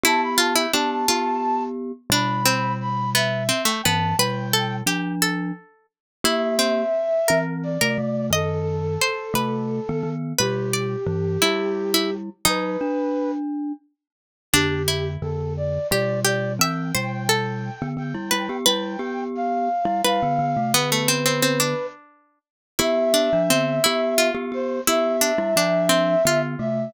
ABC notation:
X:1
M:6/8
L:1/16
Q:3/8=58
K:Ephr
V:1 name="Flute"
a b a g a a5 z2 | b4 b2 e3 g a2 | g4 z8 | e8 d4 |
A12 | G12 | B6 z6 | G4 A2 d2 d2 d2 |
g4 g4 g4 | g4 f4 f4 | B8 z4 | e10 c2 |
e10 e2 |]
V:2 name="Pizzicato Strings"
E2 F E D2 F4 z2 | D2 C4 B,2 C A, B,2 | B2 A2 G2 A4 z2 | E2 C4 _B3 B z2 |
^d4 c2 B4 z2 | B2 d4 E3 E z2 | ^D6 z6 | D2 E6 G2 G2 |
e2 c2 A6 B2 | B8 B4 | B, A, C C C D5 z2 | E2 D2 C2 E2 F4 |
E2 D2 D2 C2 F4 |]
V:3 name="Glockenspiel"
[B,G]4 [B,G]2 [B,G]6 | [B,,G,]10 [G,,E,]2 | [B,,G,]4 [F,D]4 z4 | [_B,G]4 z2 [E,C]3 [C,A,] [C,A,]2 |
[^F,,^D,]4 z2 [C,A,]3 [D,B,] [D,B,]2 | [B,,G,]4 [G,,E,]2 [G,E]6 | [^F,^D]2 =D6 z4 | [F,,D,]4 [F,,D,]4 [B,,G,]4 |
[E,C]2 [B,,G,]5 [D,B,] [D,B,] [G,E] [G,E] [B,G] | [G,E]2 [B,G]5 [G,E] [G,E] [D,B,] [D,B,] [C,A,] | [D,B,]6 z6 | [B,G]3 [F,D] [D,B,]2 [B,G]3 [B,G] [B,G]2 |
[B,G]3 [G,E] [F,D]4 [D,B,]2 [C,A,]2 |]